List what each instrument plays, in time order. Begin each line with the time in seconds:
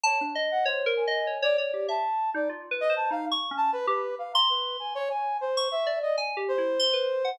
0.03 brass section C#5, electric piano 2 A5
0.21 electric piano 2 D4
0.35 electric piano 2 D#5
0.51 brass section F#5
0.65 brass section C5, electric piano 2 C#5
0.86 electric piano 2 A#4
0.97 brass section G#5
1.07 electric piano 2 D#5
1.27 electric piano 2 C#5
1.42 electric piano 2 C#5, brass section D5
1.58 electric piano 2 C#5, brass section D5
1.74 electric piano 2 G4
1.88 electric piano 2 E5, brass section A5
2.34 electric piano 2 D#4, brass section D5
2.49 electric piano 2 F4
2.71 electric piano 2 B4
2.81 brass section D#5
2.90 electric piano 2 C5
2.96 brass section A5
3.11 electric piano 2 D#4, brass section F5
3.32 electric piano 2 C#6
3.51 electric piano 2 C#4
3.57 brass section A5
3.73 brass section B4
3.87 electric piano 2 G4, brass section B4
4.19 brass section F5
4.34 brass section A#5, electric piano 2 C6
4.49 brass section B4
4.80 brass section G#5
4.95 brass section C#5
5.10 brass section G#5
5.41 brass section C5
5.57 electric piano 2 C#6
5.71 brass section E5
5.86 electric piano 2 D5
6.02 brass section D#5
6.17 electric piano 2 G#5
6.37 electric piano 2 G4
6.48 brass section C5
6.58 electric piano 2 E4
6.79 electric piano 2 C6
6.93 electric piano 2 B4
7.25 electric piano 2 F#5